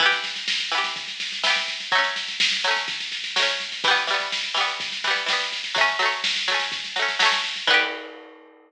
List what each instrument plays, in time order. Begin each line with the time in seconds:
0.00 pizzicato strings E3 B3, kick, snare
0.06 pizzicato strings G4
0.12 snare
0.24 snare
0.36 snare
0.48 snare
0.60 snare
0.72 pizzicato strings E3 B3, snare
0.78 pizzicato strings G4
0.84 snare
0.96 kick, snare
1.08 snare
1.20 snare
1.32 snare
1.44 pizzicato strings E3 B3, snare
1.50 pizzicato strings G4
1.56 snare
1.68 snare
1.80 snare
1.92 pizzicato strings F#3 A3, kick, snare
1.98 pizzicato strings C#4
2.04 snare
2.16 snare
2.28 snare
2.40 snare
2.52 snare
2.64 pizzicato strings F#3 A3, snare
2.71 pizzicato strings C#4
2.76 snare
2.88 kick, snare
3.00 snare
3.12 snare
3.24 snare
3.36 pizzicato strings F#3 A3, snare
3.43 pizzicato strings C#4
3.48 snare
3.60 snare
3.72 snare
3.84 pizzicato strings E3 G3, kick, snare
3.91 pizzicato strings B3
3.96 snare
4.07 pizzicato strings E3 G3, snare
4.14 pizzicato strings B3
4.20 snare
4.32 snare
4.44 snare
4.54 pizzicato strings E3 G3, snare
4.61 pizzicato strings B3
4.68 snare
4.80 kick, snare
4.92 snare
5.04 pizzicato strings E3 G3, snare
5.11 pizzicato strings B3
5.16 snare
5.26 pizzicato strings E3 G3, snare
5.33 pizzicato strings B3
5.40 snare
5.52 snare
5.64 snare
5.75 pizzicato strings F#3 A3, kick, snare
5.81 pizzicato strings C#4
5.88 snare
5.99 pizzicato strings F#3 A3, snare
6.06 pizzicato strings C#4
6.12 snare
6.24 snare
6.36 snare
6.48 pizzicato strings F#3 A3, snare
6.54 pizzicato strings C#4
6.60 snare
6.72 kick, snare
6.84 snare
6.96 pizzicato strings F#3 A3, snare
7.02 pizzicato strings C#4
7.08 snare
7.19 pizzicato strings F#3 A3, snare
7.26 pizzicato strings C#4
7.32 snare
7.44 snare
7.56 snare
7.67 pizzicato strings E3 B3, kick, crash
7.74 pizzicato strings G4